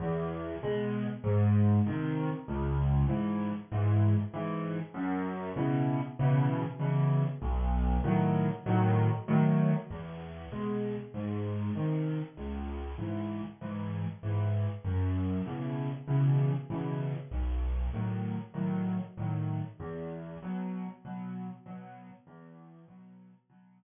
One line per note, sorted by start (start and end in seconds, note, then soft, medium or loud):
0.00 0.55 E2 loud
0.63 1.06 B2 medium
0.63 1.06 G#3 medium
1.24 1.79 G#2 loud
1.86 2.30 C3 medium
1.86 2.30 D#3 medium
2.48 3.04 C#2 loud
3.08 3.51 G#2 medium
3.08 3.51 E3 medium
3.72 4.15 G#2 medium
3.72 4.15 E3 medium
4.34 4.77 G#2 medium
4.34 4.77 E3 medium
4.94 5.50 F#2 loud
5.56 5.99 B2 medium
5.56 5.99 C#3 medium
5.56 5.99 E3 medium
6.19 6.63 B2 medium
6.19 6.63 C#3 medium
6.19 6.63 E3 medium
6.79 7.23 B2 medium
6.79 7.23 C#3 medium
6.79 7.23 E3 medium
7.42 7.97 B1 loud
8.04 8.47 A2 medium
8.04 8.47 D#3 medium
8.04 8.47 F#3 medium
8.66 9.09 A2 medium
8.66 9.09 D#3 medium
8.66 9.09 F#3 loud
9.28 9.71 A2 loud
9.28 9.71 D#3 medium
9.28 9.71 F#3 medium
9.90 10.46 E2 medium
10.52 10.95 B2 medium
10.52 10.95 G#3 medium
11.14 11.70 G#2 medium
11.75 12.19 C3 medium
11.75 12.19 D#3 medium
12.37 12.93 C#2 medium
12.98 13.41 G#2 medium
12.98 13.41 E3 medium
13.61 14.05 G#2 medium
13.61 14.05 E3 medium
14.23 14.66 G#2 medium
14.23 14.66 E3 medium
14.84 15.40 F#2 medium
15.46 15.89 B2 medium
15.46 15.89 C#3 medium
15.46 15.89 E3 medium
16.07 16.51 B2 medium
16.07 16.51 C#3 medium
16.07 16.51 E3 medium
16.70 17.13 B2 medium
16.70 17.13 C#3 medium
16.70 17.13 E3 medium
17.31 17.87 B1 medium
17.93 18.37 A2 medium
17.93 18.37 D#3 medium
17.93 18.37 F#3 medium
18.54 18.97 A2 medium
18.54 18.97 D#3 medium
18.54 18.97 F#3 medium
19.17 19.61 A2 medium
19.17 19.61 D#3 medium
19.17 19.61 F#3 medium
19.80 20.35 E2 loud
20.43 20.86 B2 medium
20.43 20.86 F#3 loud
21.05 21.48 B2 medium
21.05 21.48 F#3 medium
21.66 22.09 B2 medium
21.66 22.09 F#3 loud
22.27 22.82 E2 loud
22.88 23.31 B2 medium
22.88 23.31 F#3 medium
23.50 23.83 B2 medium
23.50 23.83 F#3 medium